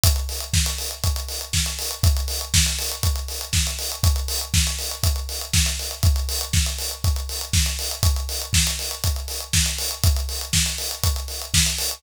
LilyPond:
\new DrumStaff \drummode { \time 4/4 \tempo 4 = 120 <hh bd>16 hh16 hho16 hh16 <bd sn>16 hh16 hho16 hh16 <hh bd>16 hh16 hho16 hh16 <bd sn>16 hh16 hho16 hh16 | <hh bd>16 hh16 hho16 hh16 <bd sn>16 hh16 hho16 hh16 <hh bd>16 hh16 hho16 hh16 <bd sn>16 hh16 hho16 hh16 | <hh bd>16 hh16 hho16 hh16 <bd sn>16 hh16 hho16 hh16 <hh bd>16 hh16 hho16 hh16 <bd sn>16 hh16 hho16 hh16 | <hh bd>16 hh16 hho16 hh16 <bd sn>16 hh16 hho16 hh16 <hh bd>16 hh16 hho16 hh16 <bd sn>16 hh16 hho16 hh16 |
<hh bd>16 hh16 hho16 hh16 <bd sn>16 hh16 hho16 hh16 <hh bd>16 hh16 hho16 hh16 <bd sn>16 hh16 hho16 hh16 | <hh bd>16 hh16 hho16 hh16 <bd sn>16 hh16 hho16 hh16 <hh bd>16 hh16 hho16 hh16 <bd sn>16 hh16 hho16 hh16 | }